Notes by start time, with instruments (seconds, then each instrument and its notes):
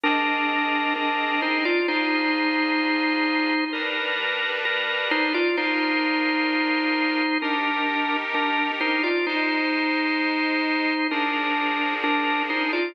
0.03 accordion C4 G#4 D#5, drawbar organ D4 A#4
0.96 drawbar organ D4 A#4
1.42 drawbar organ D#4 C5
1.65 drawbar organ F4 D5
1.88 accordion D4 F4 G#4, drawbar organ D#4 C5
3.73 accordion G3 D4 B4, drawbar organ A#4
4.65 drawbar organ A#4
5.11 drawbar organ D#4 C5
5.34 drawbar organ F4 D5
5.56 accordion D4 F4 A#4, drawbar organ D#4 C5
7.42 drawbar organ D4 A#4, accordion D#4 G4 A#4
8.34 drawbar organ D4 A#4
8.80 drawbar organ D#4 C5
9.03 drawbar organ F4 D5
9.27 accordion G#3 D#4 C5, drawbar organ D#4 C5
11.11 accordion F3 D4 G#4, drawbar organ D4 A#4
12.03 drawbar organ D4 A#4
12.50 drawbar organ D#4 C5
12.73 drawbar organ F4 D5